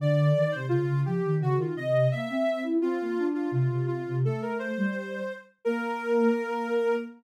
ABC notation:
X:1
M:2/2
L:1/8
Q:1/2=85
K:Bb
V:1 name="Ocarina"
d3 c F2 G2 | _G F e2 =e3 z | F3 F F2 F2 | A B c5 z |
B8 |]
V:2 name="Ocarina"
D,2 E, C, _D, D, F, E, | _D, E, C,2 B, C2 =E | C B, D2 C, C,2 C, | A,3 G,3 z2 |
B,8 |]